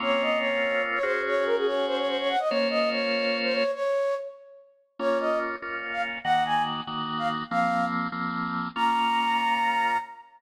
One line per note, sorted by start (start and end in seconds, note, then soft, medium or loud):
0.00 0.99 A#3 loud
0.00 0.99 C4 loud
0.00 0.99 C#4 medium
0.00 0.99 F4 medium
0.00 0.22 C#5 loud
0.22 0.39 D#5 medium
0.39 0.83 C#5 medium
0.94 1.04 C#5 medium
1.03 2.36 C#4 loud
1.03 2.36 F#4 loud
1.03 2.36 G#4 loud
1.03 1.21 C5 loud
1.27 1.44 C#5 loud
1.46 1.56 A#4 loud
1.57 1.67 G#4 medium
1.66 1.86 C#5 loud
1.87 1.97 C5 loud
1.98 2.08 C#5 medium
2.08 2.18 C5 loud
2.19 2.29 C#5 loud
2.29 2.39 F#5 medium
2.39 2.49 D#5 medium
2.49 3.63 A#3 loud
2.49 3.63 C#4 loud
2.49 3.63 F4 loud
2.49 3.63 C5 medium
2.49 2.68 C#5 loud
2.70 2.89 D#5 loud
2.91 3.37 C#5 medium
3.44 3.54 C5 loud
3.53 3.71 C#5 loud
3.74 4.15 C#5 loud
4.99 5.56 A#3 medium
4.99 5.56 C#4 medium
4.99 5.56 F4 medium
4.99 5.18 C#5 loud
5.20 5.39 D#5 medium
5.62 6.18 A#3 medium
5.62 6.18 C#4 medium
5.62 6.18 F4 medium
5.92 6.02 F5 medium
6.24 6.81 D#3 medium
6.24 6.81 A#3 medium
6.24 6.81 F#4 loud
6.24 6.43 F#5 loud
6.45 6.63 G#5 medium
6.87 7.43 D#3 medium
6.87 7.43 A#3 medium
6.87 7.43 F#4 medium
7.18 7.28 F5 medium
7.51 8.07 F3 medium
7.51 8.07 A#3 medium
7.51 8.07 C4 medium
7.51 7.85 F5 loud
8.12 8.68 F3 medium
8.12 8.68 A#3 medium
8.12 8.68 C4 medium
8.76 9.97 A#3 loud
8.76 9.97 C#4 medium
8.76 9.97 F4 medium
8.76 9.97 A#5 loud